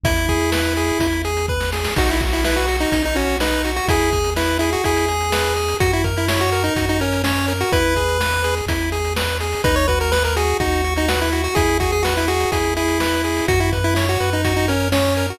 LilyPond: <<
  \new Staff \with { instrumentName = "Lead 1 (square)" } { \time 4/4 \key b \major \tempo 4 = 125 e'2~ e'8 r4. | fis'16 e'16 r16 e'16 e'16 fis'8 dis'8 dis'16 cis'8 dis'8. fis'16 | gis'4 e'8 e'16 fis'16 gis'2 | fis'16 e'16 r16 e'16 e'16 fis'8 dis'8 dis'16 cis'8 cis'8. fis'16 |
b'2 r2 | b'16 cis''16 b'16 ais'16 b'16 ais'16 gis'8 fis'8. dis'16 fis'16 e'8 fis'16 | gis'8 fis'16 gis'16 fis'16 e'16 fis'8 gis'8 e'4. | fis'16 e'16 r16 e'16 e'16 fis'8 dis'8 dis'16 cis'8 cis'8. fis'16 | }
  \new Staff \with { instrumentName = "Lead 1 (square)" } { \time 4/4 \key b \major e'8 gis'8 b'8 gis'8 e'8 gis'8 b'8 gis'8 | dis'8 fis'8 b'8 fis'8 dis'8 fis'8 b'8 fis'8 | e'8 gis'8 b'8 gis'8 e'8 gis'8 b'8 gis'8 | fis'8 ais'8 cis''8 ais'8 fis'8 ais'8 cis''8 ais'8 |
e'8 gis'8 b'8 gis'8 e'8 gis'8 b'8 gis'8 | dis'8 fis'8 b'8 fis'8 dis'8 fis'8 b'8 fis'8 | e'8 gis'8 b'8 gis'8 e'8 gis'8 b'8 gis'8 | fis'8 b'8 cis''8 b'8 fis'8 ais'8 cis''8 ais'8 | }
  \new Staff \with { instrumentName = "Synth Bass 1" } { \clef bass \time 4/4 \key b \major e,2 e,2 | b,,2 b,,2 | e,2 e,2 | fis,2 fis,2 |
e,2 e,2 | dis,2 dis,2 | e,2 e,2 | fis,4. fis,2~ fis,8 | }
  \new DrumStaff \with { instrumentName = "Drums" } \drummode { \time 4/4 <hh bd>16 hh16 <hh bd>16 hh16 sn16 hh16 hh16 hh16 <hh bd>16 hh16 hh16 hh16 bd16 sn16 sn16 sn16 | <cymc bd>16 hh16 <hh bd>16 hh16 sn16 hh16 hh16 hh16 <hh bd>16 hh16 hh16 hh16 sn16 hh16 hh16 hh16 | <hh bd>16 hh16 <hh bd>16 hh16 sn8 hh16 hh16 <hh bd>16 hh16 hh16 hh16 sn16 hh16 hh16 hh16 | <hh bd>16 hh16 <hh bd>16 hh16 sn16 hh16 hh16 hh16 <hh bd>16 hh16 hh16 hh16 sn16 hh16 hh16 hh16 |
<hh bd>16 hh16 <hh bd>16 hh16 sn16 hh16 hh16 hh16 <hh bd>16 hh16 hh16 hh16 sn16 hh16 hh16 hho16 | <hh bd>16 hh16 <hh bd>16 hh16 sn16 hh16 hh16 hh16 <hh bd>16 hh16 hh16 hh16 sn16 hh16 hh16 hh16 | <hh bd>16 hh16 <hh bd>16 hh16 sn16 hh16 hh16 hh16 <hh bd>16 hh16 hh16 hh16 sn16 hh16 hh16 hho16 | <hh bd>16 hh16 <hh bd>16 hh16 sn16 hh16 hh16 hh16 <hh bd>16 hh16 hh16 hh16 sn16 hh16 hh16 hh16 | }
>>